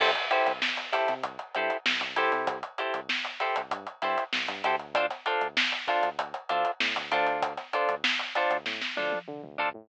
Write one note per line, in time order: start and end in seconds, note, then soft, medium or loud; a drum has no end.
0.00 0.15 C2 loud
0.00 0.11 E4 medium
0.00 0.11 G4 medium
0.00 0.11 A4 medium
0.00 0.11 C5 medium
0.00 kick loud
0.00 crash loud
0.15 closed hi-hat medium
0.30 0.52 E4 medium
0.30 0.52 G4 medium
0.30 0.52 A4 medium
0.30 0.52 C5 medium
0.30 closed hi-hat medium
0.47 0.61 C2 medium
0.47 snare soft
0.47 closed hi-hat medium
0.62 snare loud
0.77 snare soft
0.77 closed hi-hat medium
0.92 1.14 E4 medium
0.92 1.14 G4 medium
0.92 1.14 A4 medium
0.92 1.14 C5 medium
0.92 snare soft
0.92 closed hi-hat medium
1.08 1.23 C3 medium
1.08 snare soft
1.08 closed hi-hat medium
1.23 1.38 C2 medium
1.23 kick medium
1.23 closed hi-hat medium
1.39 closed hi-hat medium
1.55 1.70 G2 medium
1.55 1.77 E4 medium
1.55 1.77 G4 medium
1.55 1.77 A4 medium
1.55 1.77 C5 medium
1.55 closed hi-hat medium
1.70 closed hi-hat medium
1.86 2.00 C2 medium
1.86 snare loud
2.01 2.15 C2 medium
2.01 closed hi-hat medium
2.16 2.30 C2 medium
2.16 2.58 E4 medium
2.16 2.58 G4 medium
2.16 2.58 A4 medium
2.16 2.58 C5 medium
2.16 closed hi-hat medium
2.32 2.46 C3 medium
2.32 closed hi-hat medium
2.47 2.62 C2 loud
2.47 kick loud
2.47 closed hi-hat loud
2.63 closed hi-hat medium
2.78 3.00 E4 medium
2.78 3.00 G4 medium
2.78 3.00 A4 medium
2.78 3.00 C5 soft
2.78 closed hi-hat medium
2.94 3.08 C2 medium
2.94 closed hi-hat medium
3.09 snare loud
3.25 closed hi-hat medium
3.40 3.62 E4 medium
3.40 3.62 G4 medium
3.40 3.62 A4 medium
3.40 3.62 C5 medium
3.40 closed hi-hat medium
3.56 3.71 C2 medium
3.56 closed hi-hat medium
3.71 3.86 G2 medium
3.71 kick medium
3.71 closed hi-hat loud
3.87 closed hi-hat medium
4.02 4.16 G2 medium
4.02 4.24 E4 medium
4.02 4.24 G4 medium
4.02 4.24 A4 medium
4.02 4.24 C5 medium
4.02 snare soft
4.02 closed hi-hat medium
4.18 closed hi-hat medium
4.33 4.47 C2 medium
4.33 snare loud
4.48 4.62 G2 medium
4.48 closed hi-hat medium
4.64 5.09 D2 loud
4.64 4.75 E4 medium
4.64 4.75 G4 medium
4.64 4.75 A4 medium
4.64 4.75 C5 medium
4.64 closed hi-hat medium
4.79 closed hi-hat medium
4.95 5.06 D4 medium
4.95 5.06 F4 medium
4.95 5.06 A4 medium
4.95 5.06 C5 medium
4.95 kick loud
4.95 closed hi-hat loud
5.10 snare soft
5.10 closed hi-hat medium
5.26 5.47 D4 medium
5.26 5.47 F4 medium
5.26 5.47 A4 medium
5.26 5.47 C5 medium
5.26 closed hi-hat medium
5.41 5.55 D2 medium
5.41 closed hi-hat medium
5.57 snare loud
5.72 closed hi-hat medium
5.88 6.09 D4 medium
5.88 6.09 F4 medium
5.88 6.09 A4 medium
5.88 6.09 C5 medium
5.88 kick medium
5.88 closed hi-hat medium
6.03 6.17 D2 medium
6.03 closed hi-hat medium
6.19 6.33 D2 medium
6.19 kick medium
6.19 closed hi-hat loud
6.34 closed hi-hat medium
6.49 6.64 D2 medium
6.49 6.71 D4 medium
6.49 6.71 F4 medium
6.49 6.71 A4 medium
6.49 6.71 C5 medium
6.49 closed hi-hat medium
6.65 closed hi-hat medium
6.80 6.95 A2 medium
6.80 snare loud
6.96 7.11 D2 medium
6.96 closed hi-hat medium
7.11 7.57 D2 loud
7.11 7.53 D4 medium
7.11 7.53 F4 medium
7.11 7.53 A4 medium
7.11 7.53 C5 medium
7.11 closed hi-hat medium
7.27 closed hi-hat medium
7.42 kick loud
7.42 closed hi-hat loud
7.57 snare soft
7.57 closed hi-hat medium
7.73 7.95 D4 medium
7.73 7.95 F4 medium
7.73 7.95 A4 medium
7.73 7.95 C5 medium
7.73 closed hi-hat medium
7.88 8.02 D2 medium
7.88 closed hi-hat medium
8.04 snare loud
8.19 closed hi-hat medium
8.35 8.57 D4 medium
8.35 8.57 F4 medium
8.35 8.57 A4 medium
8.35 8.57 C5 medium
8.35 closed hi-hat medium
8.51 8.65 D2 medium
8.51 closed hi-hat medium
8.66 8.80 A2 medium
8.66 kick medium
8.66 snare medium
8.82 snare medium
8.97 9.12 D2 medium
8.97 9.19 D4 medium
8.97 9.19 F4 medium
8.97 9.19 A4 medium
8.97 9.19 C5 medium
8.97 high tom medium
9.12 high tom medium
9.28 9.42 D3 medium
9.28 mid tom medium
9.44 9.58 D2 medium
9.44 mid tom medium
9.58 9.73 D2 medium
9.58 9.69 D4 medium
9.58 9.69 F4 medium
9.58 9.69 A4 medium
9.58 9.69 C5 medium
9.58 floor tom medium
9.74 9.88 A2 medium